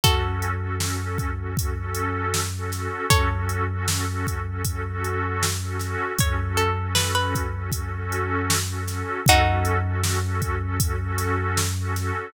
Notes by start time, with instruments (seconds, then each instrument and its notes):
0.04 synth bass 2 F#2, pad 2 (warm) C#4 F#4 A4, pizzicato strings F#4 A4, kick, closed hi-hat
0.24 pad 2 (warm) C#4 F#4 A4
0.42 closed hi-hat
0.62 pad 2 (warm) C#4 F#4 A4
0.80 pad 2 (warm) C#4 F#4 A4, snare
1.00 pad 2 (warm) C#4 F#4 A4
1.18 kick, closed hi-hat
1.40 pad 2 (warm) C#4 F#4 A4
1.56 pad 2 (warm) C#4 F#4 A4, kick, closed hi-hat
1.79 pad 2 (warm) C#4 F#4 A4
1.95 closed hi-hat
2.34 snare
2.57 pad 2 (warm) C#4 F#4 A4
2.72 pad 2 (warm) C#4 F#4 A4, snare, closed hi-hat
3.10 synth bass 2 F#2, pad 2 (warm) C#4 F#4 A4, pizzicato strings A4 C#5, kick, closed hi-hat
3.34 pad 2 (warm) C#4 F#4 A4
3.49 closed hi-hat
3.72 pad 2 (warm) C#4 F#4 A4
3.88 pad 2 (warm) C#4 F#4 A4, snare
4.08 pad 2 (warm) C#4 F#4 A4
4.27 kick, closed hi-hat
4.48 pad 2 (warm) C#4 F#4 A4
4.65 pad 2 (warm) C#4 F#4 A4, kick, closed hi-hat
4.86 pad 2 (warm) C#4 F#4 A4
5.04 closed hi-hat
5.43 snare
5.62 pad 2 (warm) C#4 F#4 A4
5.79 pad 2 (warm) C#4 F#4 A4, snare, closed hi-hat
6.18 synth bass 2 F#2, pad 2 (warm) C#4 F#4 A4, pizzicato strings C#5, kick, closed hi-hat
6.39 pad 2 (warm) C#4 F#4 A4
6.57 pizzicato strings A4, closed hi-hat
6.79 pad 2 (warm) C#4 F#4 A4
6.95 pad 2 (warm) C#4 F#4 A4, pizzicato strings B4, snare
7.15 pad 2 (warm) C#4 F#4 A4, pizzicato strings B4
7.35 kick, closed hi-hat
7.56 pad 2 (warm) C#4 F#4 A4
7.72 pad 2 (warm) C#4 F#4 A4, kick, closed hi-hat
7.94 pad 2 (warm) C#4 F#4 A4
8.12 closed hi-hat
8.50 snare
8.69 pad 2 (warm) C#4 F#4 A4
8.88 pad 2 (warm) C#4 F#4 A4, snare, closed hi-hat
9.25 synth bass 2 F#2, pad 2 (warm) C#4 F#4 A4, kick, closed hi-hat
9.29 pizzicato strings D#4 F#4
9.48 pad 2 (warm) C#4 F#4 A4
9.65 closed hi-hat
9.86 pad 2 (warm) C#4 F#4 A4
10.02 pad 2 (warm) C#4 F#4 A4, snare
10.25 pad 2 (warm) C#4 F#4 A4
10.42 kick, closed hi-hat
10.63 pad 2 (warm) C#4 F#4 A4
10.79 pad 2 (warm) C#4 F#4 A4, kick, closed hi-hat
11.00 pad 2 (warm) C#4 F#4 A4
11.18 snare, closed hi-hat
11.57 snare
11.79 pad 2 (warm) C#4 F#4 A4
11.96 pad 2 (warm) C#4 F#4 A4, snare, closed hi-hat